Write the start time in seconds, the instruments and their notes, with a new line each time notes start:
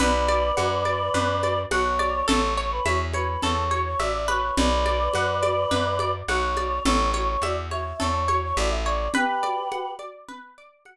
0.00 electric bass (finger) B1, orchestral harp B4, choir aahs B4 D5, low conga
0.28 orchestral harp D5, high conga
0.57 electric bass (finger) F#2, orchestral harp F#5, high conga
0.85 orchestral harp D5, high conga
1.14 electric bass (finger) F#2, orchestral harp B4, low conga
1.43 orchestral harp D5, high conga
1.71 electric bass (finger) B1, choir aahs C#5, orchestral harp F#5, high conga
1.99 orchestral harp D5, high conga
2.28 electric bass (finger) A1, orchestral harp A4, choir aahs C#5, low conga
2.57 choir aahs C#5, orchestral harp C#5
2.72 choir aahs B4
2.85 electric bass (finger) E2, choir aahs C#5, orchestral harp E5, high conga
3.13 choir aahs B4, orchestral harp C#5, high conga
3.43 electric bass (finger) E2, orchestral harp A4, choir aahs C#5, low conga
3.71 orchestral harp C#5, high conga
3.86 choir aahs C#5
4.00 electric bass (finger) A1, choir aahs D5, orchestral harp E5, high conga
4.14 choir aahs D5
4.28 orchestral harp B4, choir aahs C#5, high conga
4.57 electric bass (finger) B1, choir aahs B4 D5, low conga
4.86 orchestral harp D5, high conga
5.14 electric bass (finger) F#2, orchestral harp F#5, high conga
5.43 orchestral harp D5, high conga
5.71 electric bass (finger) F#2, orchestral harp B4, low conga
5.99 orchestral harp D5, high conga
6.28 electric bass (finger) B1, choir aahs C#5, orchestral harp F#5, high conga
6.57 orchestral harp D5, high conga
6.85 electric bass (finger) A1, orchestral harp A4, choir aahs C#5, low conga
7.14 orchestral harp C#5, choir aahs C#5, high conga
7.28 choir aahs C#5
7.42 electric bass (finger) E2, choir aahs D5, orchestral harp E5, high conga
7.71 orchestral harp C#5, choir aahs E5, high conga
8.00 electric bass (finger) E2, orchestral harp A4, choir aahs C#5, low conga
8.28 orchestral harp C#5, high conga
8.43 choir aahs C#5
8.57 electric bass (finger) A1, choir aahs D5, orchestral harp E5, high conga
8.71 choir aahs E5
8.86 orchestral harp C#5, choir aahs D5
9.14 choir aahs G4 B4, orchestral harp B4, low conga
9.43 orchestral harp D5, high conga
9.72 orchestral harp F#5, high conga
9.99 orchestral harp D5, high conga
10.28 orchestral harp B4, low conga
10.58 orchestral harp D5
10.85 orchestral harp F#5, high conga